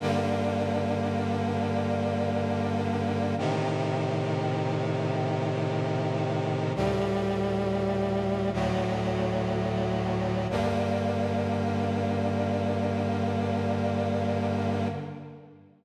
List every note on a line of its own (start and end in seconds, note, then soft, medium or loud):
0.00 3.35 G2 medium
0.00 3.35 D3 loud
0.00 3.35 A#3 medium
3.38 6.73 A2 medium
3.38 6.73 C3 loud
3.38 6.73 D#3 medium
6.75 8.51 D2 loud
6.75 8.51 A2 medium
6.75 8.51 G3 loud
8.53 10.47 D2 medium
8.53 10.47 A2 loud
8.53 10.47 F#3 medium
10.50 14.88 G2 loud
10.50 14.88 D3 medium
10.50 14.88 A#3 medium